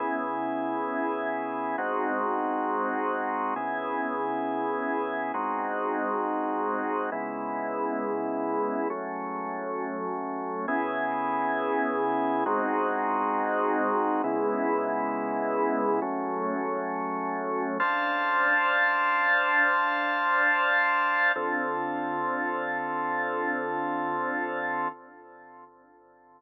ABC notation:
X:1
M:7/8
L:1/8
Q:1/4=118
K:C#m
V:1 name="Drawbar Organ"
[C,B,EG]7 | [G,^B,DF]7 | [C,B,EG]7 | [G,^B,DF]7 |
[C,G,B,E]7 | [F,A,C]7 | [C,B,EG]7 | [G,^B,DF]7 |
[C,G,B,E]7 | [F,A,C]7 | [K:Dm] [Dcfa]7- | [Dcfa]7 |
[D,CFA]7- | [D,CFA]7 |]